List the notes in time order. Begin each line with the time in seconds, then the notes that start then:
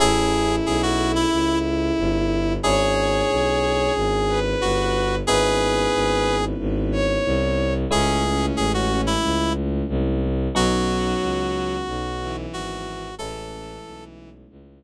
0.00 A1 C#4 E4 G#4 A4
0.66 B1 G#4
0.83 F#4
1.15 E4
1.32 C#2
1.98 G1
2.63 G#1 C#4 D4 E4 G#4 C#5
3.30 B1
3.95 G#1
4.28 B4
4.61 G1 F#4
5.27 G#1 B3 C#4 D#4 E4 G#4 B4
5.94 G#1
6.59 G#1
6.92 C#5
7.25 C2
7.91 C#2 G#3 A3 C#4 E4 G#4
8.24 C#4
8.57 A1 G#4
8.74 F#4
9.07 E4
9.23 C#2
9.89 C2
10.55 B1 F#3 B3 C#4 D#4 F#4
11.22 C#2
11.87 B1
12.20 E3
12.53 G#1 F#4
13.18 A1 E3 G#3 A3 C#4 E4 A4
13.85 B1
14.50 C#2